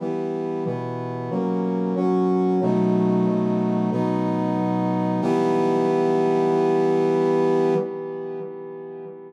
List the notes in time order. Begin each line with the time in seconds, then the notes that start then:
0.00 E3 G3 B3
0.65 B2 E3 B3
1.30 F#3 A#3 C#4
1.96 F#3 C#4 F#4
2.61 B2 F#3 A3 D#4
3.92 B2 F#3 B3 D#4
5.22 E3 G3 B3